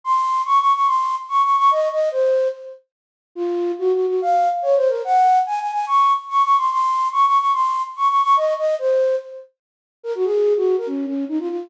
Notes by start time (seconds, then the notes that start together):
0.04 C6
0.45 C#6
0.59 C#6
0.74 C#6
0.86 C6
1.29 C#6
1.42 C#6
1.57 C#6
1.71 D#5
1.92 D#5
2.11 C5
3.35 F4
3.79 F#4
3.93 F#4
4.07 F#4
4.21 F5
4.62 C#5
4.76 C5
4.88 A#4
5.05 F#5
5.46 G#5
5.60 G#5
5.72 G#5
5.87 C#6
6.29 C#6
6.43 C#6
6.57 C6
6.70 C6
7.12 C#6
7.26 C#6
7.38 C#6
7.53 C6
7.96 C#6
8.08 C#6
8.22 C#6
8.37 D#5
8.57 D#5
8.79 C5
10.03 A#4
10.15 F#4
10.24 G#4
10.57 F#4
10.78 A#4
10.87 C#4
11.06 C#4
11.28 D#4
11.39 F4
11.49 F4